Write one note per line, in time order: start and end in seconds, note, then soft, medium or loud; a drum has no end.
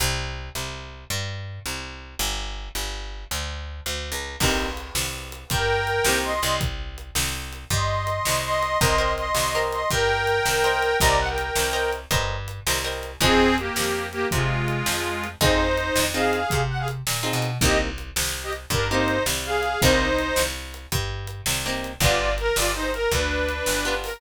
0.00 0.50 C2 loud
0.55 1.05 C2 medium
1.10 1.60 G2 medium
1.66 2.15 C2 medium
2.19 2.69 G1 medium
2.75 3.25 G1 medium
3.31 3.81 D2 medium
3.86 4.11 D2 medium
4.12 4.36 C#2 medium
4.40 4.90 C2 medium
4.40 4.68 A#3 medium
4.40 4.68 C4 medium
4.40 4.68 D#4 medium
4.40 4.68 G4 medium
4.40 kick medium
4.40 crash medium
4.77 closed hi-hat medium
4.95 5.44 C2 medium
4.95 snare medium
5.32 closed hi-hat medium
5.50 6.00 G2 medium
5.50 6.17 A#4 medium
5.50 6.17 G5 medium
5.50 kick medium
5.50 closed hi-hat medium
5.87 closed hi-hat medium
6.05 6.40 C2 medium
6.05 6.32 A#3 medium
6.05 6.32 C4 medium
6.05 6.32 D#4 medium
6.05 6.32 G4 medium
6.05 snare medium
6.24 6.56 D#5 medium
6.24 6.56 C6 medium
6.43 7.11 C2 medium
6.43 closed hi-hat medium
6.61 kick medium
6.61 closed hi-hat medium
6.98 closed hi-hat medium
7.15 7.65 C2 medium
7.15 snare medium
7.53 closed hi-hat medium
7.70 8.20 G2 medium
7.70 8.42 D#5 soft
7.70 8.42 C6 medium
7.70 kick medium
7.70 closed hi-hat medium
8.07 closed hi-hat medium
8.25 8.76 C2 medium
8.25 snare medium
8.44 8.78 D#5 medium
8.44 8.78 C6 medium
8.62 closed hi-hat medium
8.80 9.31 C2 loud
8.80 8.94 A#4 medium
8.80 8.94 C5 medium
8.80 9.13 D#5 medium
8.80 8.94 D#5 medium
8.80 8.94 G5 medium
8.80 9.13 C6 medium
8.80 kick medium
8.80 closed hi-hat medium
8.98 9.24 A#4 medium
8.98 9.24 C5 medium
8.98 9.24 D#5 medium
8.98 9.24 G5 medium
9.17 9.63 D#5 medium
9.17 9.63 C6 medium
9.17 closed hi-hat medium
9.35 9.84 C2 medium
9.35 snare medium
9.55 9.81 A#4 medium
9.55 9.81 C5 medium
9.55 9.81 D#5 medium
9.55 9.81 G5 medium
9.72 9.89 D#5 medium
9.72 9.89 C6 medium
9.72 closed hi-hat medium
9.90 10.41 G2 medium
9.90 10.97 A#4 medium
9.90 10.97 G5 medium
9.90 kick medium
9.90 closed hi-hat medium
10.27 closed hi-hat medium
10.45 10.95 C2 medium
10.45 snare medium
10.64 10.90 A#4 medium
10.64 10.90 C5 medium
10.64 10.90 D#5 medium
10.64 10.90 G5 medium
10.82 closed hi-hat medium
11.00 11.51 C2 loud
11.00 11.28 A#4 medium
11.00 11.28 C5 medium
11.00 11.16 D5 medium
11.00 11.28 D#5 medium
11.00 11.28 G5 medium
11.00 11.16 A#5 medium
11.00 kick medium
11.00 closed hi-hat medium
11.19 11.28 F#5 medium
11.29 11.91 A#4 medium
11.29 11.91 G5 medium
11.38 closed hi-hat medium
11.56 12.06 C2 medium
11.56 snare medium
11.73 11.99 A#4 medium
11.73 11.99 C5 medium
11.73 11.99 D#5 medium
11.73 11.99 G5 medium
11.93 closed hi-hat medium
12.11 12.60 G2 medium
12.11 12.36 A#4 medium
12.11 12.36 C5 medium
12.11 12.36 D#5 medium
12.11 12.36 G5 medium
12.11 kick medium
12.11 closed hi-hat medium
12.48 closed hi-hat medium
12.67 13.16 C2 medium
12.67 12.80 A#4 medium
12.67 12.80 C5 medium
12.67 12.80 D#5 medium
12.67 12.80 G5 medium
12.67 snare medium
12.84 13.10 A#4 medium
12.84 13.10 C5 medium
12.84 13.10 D#5 medium
12.84 13.10 G5 medium
13.03 closed hi-hat medium
13.21 13.70 F2 medium
13.21 13.56 C4 medium
13.21 13.47 C4 medium
13.21 13.47 D#4 medium
13.21 13.47 F4 medium
13.21 13.56 G#4 medium
13.21 13.47 G#4 medium
13.21 kick medium
13.21 closed hi-hat medium
13.58 14.07 A#3 medium
13.58 14.07 G4 medium
13.58 closed hi-hat medium
13.76 14.26 F2 medium
13.76 snare medium
14.12 14.27 A#3 medium
14.12 14.27 G4 medium
14.12 closed hi-hat medium
14.31 14.82 C3 medium
14.31 15.27 G#3 medium
14.31 15.27 F4 medium
14.31 kick medium
14.31 closed hi-hat medium
14.68 closed hi-hat medium
14.86 15.36 F2 medium
14.86 snare medium
15.24 closed hi-hat medium
15.41 15.90 F2 medium
15.41 15.67 C4 medium
15.41 15.67 D#4 medium
15.41 16.05 D#4 medium
15.41 15.67 F4 medium
15.41 15.67 G#4 medium
15.41 16.05 C5 medium
15.41 kick loud
15.41 closed hi-hat medium
15.77 closed hi-hat medium
15.96 16.45 F2 medium
15.96 snare medium
16.14 16.40 C4 medium
16.14 16.40 D#4 medium
16.14 16.40 F4 medium
16.14 16.40 G#4 medium
16.14 16.61 G#4 medium
16.14 16.61 F5 medium
16.33 closed hi-hat medium
16.50 17.02 C3 medium
16.50 kick medium
16.50 closed hi-hat medium
16.69 16.78 F#5 medium
16.79 16.87 G#4 medium
16.79 16.87 F5 medium
16.88 closed hi-hat medium
17.07 17.32 A#2 medium
17.07 snare medium
17.23 17.49 C4 medium
17.23 17.49 D#4 medium
17.23 17.49 F4 medium
17.23 17.49 G#4 medium
17.33 17.58 B2 medium
17.42 closed hi-hat medium
17.61 18.11 C2 loud
17.61 17.88 A#3 medium
17.61 17.88 C4 medium
17.61 17.88 D#4 medium
17.61 17.78 G4 medium
17.61 17.88 G4 medium
17.61 17.78 D#5 medium
17.61 kick medium
17.61 closed hi-hat medium
17.98 closed hi-hat medium
18.16 18.66 C2 medium
18.16 snare loud
18.43 18.52 G4 medium
18.43 18.52 D#5 medium
18.53 closed hi-hat medium
18.70 19.20 G2 medium
18.70 18.87 D4 medium
18.70 18.87 A#4 medium
18.70 kick medium
18.70 closed hi-hat medium
18.90 19.17 A#3 medium
18.90 19.17 C4 medium
18.90 19.23 D#4 medium
18.90 19.17 D#4 medium
18.90 19.17 G4 medium
18.90 19.23 C5 medium
19.08 closed hi-hat medium
19.26 19.76 C2 medium
19.26 snare medium
19.45 19.81 G#4 medium
19.45 19.81 F5 medium
19.63 closed hi-hat medium
19.82 20.32 C2 medium
19.82 20.08 A#3 medium
19.82 20.08 C4 medium
19.82 20.43 D#4 medium
19.82 20.08 D#4 medium
19.82 20.08 G4 medium
19.82 20.43 C5 medium
19.82 kick medium
19.82 closed hi-hat medium
20.18 closed hi-hat medium
20.36 20.87 C2 medium
20.36 snare medium
20.74 closed hi-hat medium
20.92 21.42 G2 medium
20.92 kick medium
20.92 closed hi-hat medium
21.27 closed hi-hat medium
21.46 21.96 C2 medium
21.46 snare medium
21.66 21.91 A#3 medium
21.66 21.91 C4 medium
21.66 21.91 D#4 medium
21.66 21.91 G4 medium
21.84 closed hi-hat medium
22.00 22.50 G1 loud
22.00 22.28 B3 medium
22.00 22.28 D4 medium
22.00 22.33 F4 medium
22.00 22.28 F4 medium
22.00 22.28 G4 medium
22.00 22.33 D5 medium
22.00 kick medium
22.00 closed hi-hat medium
22.38 22.56 A#4 medium
22.38 closed hi-hat medium
22.56 23.06 G1 medium
22.56 22.72 F4 medium
22.56 22.72 D5 medium
22.56 snare medium
22.75 22.91 D#4 medium
22.75 22.91 C5 medium
22.94 23.11 A#4 medium
22.94 closed hi-hat medium
23.11 23.61 D2 medium
23.11 23.94 D4 medium
23.11 23.94 B4 medium
23.11 kick medium
23.11 closed hi-hat medium
23.49 closed hi-hat medium
23.66 24.17 G1 medium
23.66 snare medium
23.85 24.11 B3 medium
23.85 24.11 D4 medium
23.85 24.11 F4 medium
23.85 24.11 G4 medium
24.04 24.20 A#4 medium
24.04 open hi-hat medium